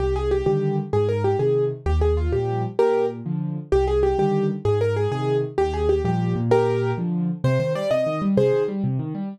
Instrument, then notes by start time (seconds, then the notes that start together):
acoustic grand piano
0.00 C2 G4
0.16 G#4
0.31 G4
0.46 D3 D#3 G3 G4
0.93 G#2 G#4
1.09 A#4
1.24 G4
1.39 C3 D#3 G#4
1.86 D#2 G4
2.01 G#4
2.17 F4
2.32 A#2 F3 G3 G4
2.79 A#2 G4 A#4
3.26 D3 F3
3.72 C2 G4
3.87 G#4
4.03 G4
4.19 D3 D#3 G3 G4
4.65 G#2 G#4
4.81 A#4
4.96 G#4
5.12 C3 D#3 G#4
5.58 D#2 G4
5.74 G#4
5.89 G4
6.05 A#2 F3 G3 G4
6.36 A#2
6.51 G4 A#4
6.98 D3 F3
7.44 C3 C5
7.60 D#3 C5
7.75 G3 D5
7.91 C3 D#5
8.06 D#3
8.22 G3
8.37 C3 G#4 C5
8.53 D#3
8.68 G3
8.84 C3
8.99 D#3
9.15 G3